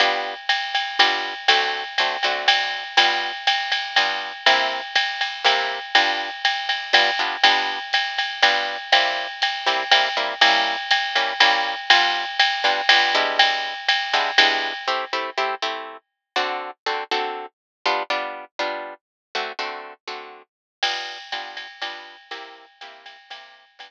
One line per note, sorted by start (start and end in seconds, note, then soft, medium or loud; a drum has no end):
0.00 0.34 G3 medium
0.00 0.34 B3 medium
0.00 0.34 D4 medium
0.00 0.34 F4 medium
0.00 ride medium
0.49 hi-hat pedal medium
0.49 ride medium
0.75 ride medium
0.99 1.34 G3 medium
0.99 1.34 B3 medium
0.99 1.34 D4 medium
0.99 1.34 F4 medium
0.99 ride medium
1.48 1.84 D3 medium
1.48 1.84 A3 medium
1.48 1.84 C4 loud
1.48 1.84 F#4 medium
1.48 ride medium
1.98 2.17 D3 medium
1.98 2.17 A3 medium
1.98 2.17 C4 medium
1.98 2.17 F#4 medium
1.98 hi-hat pedal medium
1.98 ride medium
2.23 2.84 D3 medium
2.23 2.84 A3 medium
2.23 2.84 C4 medium
2.23 2.84 F#4 medium
2.23 ride medium
2.48 ride medium
2.97 3.32 G3 medium
2.97 3.32 B3 medium
2.97 3.32 D4 medium
2.97 3.32 F4 medium
2.97 ride medium
3.47 hi-hat pedal medium
3.47 ride medium
3.72 ride medium
3.96 4.32 G3 medium
3.96 4.32 B3 medium
3.96 4.32 D4 medium
3.96 4.32 F4 medium
3.96 ride medium
4.46 4.81 C3 loud
4.46 4.81 A#3 medium
4.46 4.81 E4 loud
4.46 4.81 G4 medium
4.46 ride medium
4.95 kick soft
4.95 hi-hat pedal medium
4.95 ride medium
5.21 ride medium
5.45 5.79 C3 medium
5.45 5.79 A#3 medium
5.45 5.79 E4 medium
5.45 5.79 G4 medium
5.45 kick soft
5.45 ride medium
5.95 6.30 G3 medium
5.95 6.30 B3 medium
5.95 6.30 D4 loud
5.95 6.30 F4 medium
5.95 ride medium
6.45 hi-hat pedal medium
6.45 ride medium
6.69 ride medium
6.93 7.11 G3 medium
6.93 7.11 B3 medium
6.93 7.11 D4 medium
6.93 7.11 F4 medium
6.93 ride medium
7.19 7.36 G3 medium
7.19 7.36 B3 medium
7.19 7.36 D4 medium
7.19 7.36 F4 medium
7.43 7.79 G3 medium
7.43 7.79 B3 medium
7.43 7.79 D4 medium
7.43 7.79 F4 medium
7.43 ride medium
7.93 hi-hat pedal medium
7.93 ride medium
8.18 ride medium
8.42 8.77 G3 medium
8.42 8.77 B3 medium
8.42 8.77 D4 loud
8.42 8.77 F4 medium
8.42 ride medium
8.92 9.27 G3 loud
8.92 9.27 A#3 medium
8.92 9.27 C4 medium
8.92 9.27 E4 medium
8.92 ride medium
9.42 hi-hat pedal medium
9.42 ride medium
9.66 9.84 G3 medium
9.66 9.84 A#3 medium
9.66 9.84 C4 medium
9.66 9.84 E4 medium
9.66 ride medium
9.91 10.09 G3 medium
9.91 10.09 A#3 medium
9.91 10.09 C4 medium
9.91 10.09 E4 medium
9.91 kick soft
9.91 ride medium
10.17 10.34 G3 medium
10.17 10.34 A#3 medium
10.17 10.34 C4 medium
10.17 10.34 E4 medium
10.41 10.76 G3 medium
10.41 10.76 A#3 loud
10.41 10.76 C#4 medium
10.41 10.76 E4 medium
10.41 ride loud
10.91 hi-hat pedal medium
10.91 ride medium
11.15 11.33 G3 medium
11.15 11.33 A#3 medium
11.15 11.33 C#4 medium
11.15 11.33 E4 medium
11.15 ride medium
11.40 11.75 G3 loud
11.40 11.75 A#3 medium
11.40 11.75 C#4 medium
11.40 11.75 E4 medium
11.40 ride medium
11.90 12.25 G3 loud
11.90 12.25 B3 medium
11.90 12.25 D4 medium
11.90 12.25 F4 loud
11.90 kick soft
11.90 ride medium
12.39 hi-hat pedal medium
12.39 ride medium
12.64 12.81 G3 medium
12.64 12.81 B3 medium
12.64 12.81 D4 medium
12.64 12.81 F4 medium
12.64 ride medium
12.89 13.14 G3 medium
12.89 13.14 B3 medium
12.89 13.14 D4 medium
12.89 13.14 F4 medium
12.89 ride loud
13.15 13.74 G3 medium
13.15 13.74 G#3 loud
13.15 13.74 B3 medium
13.15 13.74 D4 loud
13.15 13.74 E4 loud
13.39 ride medium
13.89 hi-hat pedal medium
13.89 ride medium
14.13 14.31 G3 medium
14.13 14.31 G#3 medium
14.13 14.31 B3 medium
14.13 14.31 D4 medium
14.13 14.31 E4 medium
14.13 ride medium
14.38 14.73 G3 medium
14.38 14.73 G#3 medium
14.38 14.73 B3 medium
14.38 14.73 D4 medium
14.38 14.73 E4 medium
14.38 ride medium
14.88 15.05 A3 medium
14.88 15.05 C4 medium
14.88 15.05 E4 medium
14.88 15.05 G4 medium
15.13 15.30 A3 medium
15.13 15.30 C4 medium
15.13 15.30 E4 medium
15.13 15.30 G4 medium
15.38 15.55 A3 medium
15.38 15.55 C4 medium
15.38 15.55 E4 medium
15.38 15.55 G4 medium
15.62 15.97 A3 medium
15.62 15.97 C4 medium
15.62 15.97 E4 medium
15.62 15.97 G4 medium
16.36 16.71 D3 loud
16.36 16.71 C4 medium
16.36 16.71 F#4 loud
16.36 16.71 A4 medium
16.86 17.04 D3 medium
16.86 17.04 C4 medium
16.86 17.04 F#4 medium
16.86 17.04 A4 medium
17.11 17.46 D3 medium
17.11 17.46 C4 medium
17.11 17.46 F#4 medium
17.11 17.46 A4 medium
17.86 18.03 G3 medium
17.86 18.03 B3 medium
17.86 18.03 D4 loud
17.86 18.03 F4 loud
18.10 18.45 G3 medium
18.10 18.45 B3 medium
18.10 18.45 D4 medium
18.10 18.45 F4 medium
18.59 18.94 G3 medium
18.59 18.94 B3 medium
18.59 18.94 D4 medium
18.59 18.94 F4 medium
19.35 19.52 D3 medium
19.35 19.52 A3 loud
19.35 19.52 C4 medium
19.35 19.52 F#4 loud
19.59 19.93 D3 medium
19.59 19.93 A3 medium
19.59 19.93 C4 medium
19.59 19.93 F#4 medium
20.07 20.42 D3 medium
20.07 20.42 A3 medium
20.07 20.42 C4 medium
20.07 20.42 F#4 medium
20.83 21.18 G3 medium
20.83 21.18 B3 medium
20.83 21.18 D4 medium
20.83 21.18 F4 medium
20.83 crash medium
20.83 ride medium
21.32 21.67 G3 medium
21.32 21.67 B3 medium
21.32 21.67 D4 medium
21.32 21.67 F4 medium
21.32 kick medium
21.32 hi-hat pedal medium
21.32 ride medium
21.57 ride medium
21.82 22.16 G3 medium
21.82 22.16 B3 loud
21.82 22.16 D4 medium
21.82 22.16 F4 medium
21.82 ride medium
22.31 22.66 C3 medium
22.31 22.66 A#3 loud
22.31 22.66 E4 loud
22.31 22.66 G4 loud
22.31 ride medium
22.81 23.17 C3 medium
22.81 23.17 A#3 medium
22.81 23.17 E4 medium
22.81 23.17 G4 medium
22.81 hi-hat pedal medium
22.81 ride medium
23.06 ride medium
23.30 23.65 C3 medium
23.30 23.65 A#3 medium
23.30 23.65 E4 medium
23.30 23.65 G4 medium
23.30 ride medium
23.79 23.91 G3 loud
23.79 23.91 B3 medium
23.79 23.91 D4 loud
23.79 23.91 F4 medium
23.79 ride medium